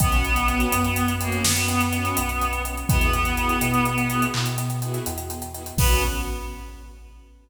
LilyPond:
<<
  \new Staff \with { instrumentName = "Clarinet" } { \time 12/8 \key b \major \tempo 4. = 83 b2~ b8 ais8 b2. | b2.~ b8 r2 r8 | b4. r1 r8 | }
  \new Staff \with { instrumentName = "String Ensemble 1" } { \time 12/8 \key b \major <b cis' fis'>4 <b cis' fis'>4. <b cis' fis'>4. <b cis' fis'>4. <b cis' fis'>8 | <b e' fis' gis'>4 <b e' fis' gis'>4. <b e' fis' gis'>4. <b e' fis' gis'>4. <b e' fis' gis'>8 | <b cis' fis'>4. r1 r8 | }
  \new Staff \with { instrumentName = "Synth Bass 2" } { \clef bass \time 12/8 \key b \major b,,4. fis,4. fis,4. b,,4. | e,4. b,4. b,4. e,4. | b,,4. r1 r8 | }
  \new DrumStaff \with { instrumentName = "Drums" } \drummode { \time 12/8 <hh bd>16 hh16 hh16 hh16 hh16 hh16 hh16 hh16 hh16 hh16 hh16 hh16 sn16 hh16 hh16 hh16 hh16 hh16 hh16 hh16 hh16 hh16 hh16 hh16 | <hh bd>16 hh16 hh16 hh16 hh16 hh16 hh16 hh16 hh16 hh16 hh16 hh16 hc16 hh16 hh16 hh16 hh16 hh16 hh16 hh16 hh16 hh16 hh16 hh16 | <cymc bd>4. r4. r4. r4. | }
>>